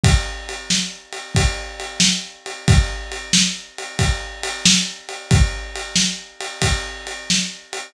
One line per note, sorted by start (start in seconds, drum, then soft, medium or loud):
0.04 kick medium
0.04 ride medium
0.49 ride medium
0.70 snare medium
1.13 ride medium
1.35 kick medium
1.35 ride medium
1.80 ride medium
2.00 snare medium
2.46 ride medium
2.68 kick medium
2.68 ride medium
3.12 ride medium
3.33 snare loud
3.78 ride medium
3.99 kick medium
3.99 ride medium
4.43 ride medium
4.65 snare loud
5.09 ride medium
5.31 kick medium
5.31 ride medium
5.75 ride medium
5.96 snare medium
6.40 ride medium
6.62 kick medium
6.62 ride medium
7.07 ride medium
7.30 snare medium
7.73 ride medium